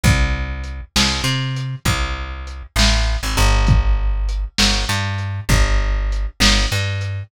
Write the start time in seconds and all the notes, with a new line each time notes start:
0.03 C2, kick, closed hi-hat
0.64 closed hi-hat
0.96 C2, snare
1.24 C3
1.56 closed hi-hat
1.85 C2, kick, closed hi-hat
2.47 closed hi-hat
2.76 A1, snare
3.23 G#1
3.37 G1, closed hi-hat
3.67 kick, closed hi-hat
4.29 closed hi-hat
4.58 G1, snare
4.89 G2
5.18 closed hi-hat
5.49 G1, kick, closed hi-hat
6.12 closed hi-hat
6.40 G1, snare
6.72 G2
7.01 closed hi-hat